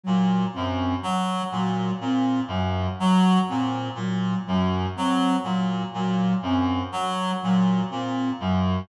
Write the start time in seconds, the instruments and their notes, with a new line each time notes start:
0.03 clarinet A#2, flute F#3
0.53 clarinet F#2, flute C4
1.02 flute F#3, clarinet F#3
1.52 clarinet A#2, flute F#3
2.01 clarinet A#2, flute C4
2.48 clarinet F#2, flute F#3
2.99 flute F#3, clarinet F#3
3.48 clarinet A#2, flute C4
3.95 clarinet A#2, flute F#3
4.47 clarinet F#2, flute F#3
4.96 clarinet F#3, flute C4
5.44 clarinet A#2, flute F#3
5.94 clarinet A#2, flute F#3
6.42 clarinet F#2, flute C4
6.92 clarinet F#3, flute F#3
7.42 clarinet A#2, flute F#3
7.90 clarinet A#2, flute C4
8.40 clarinet F#2, flute F#3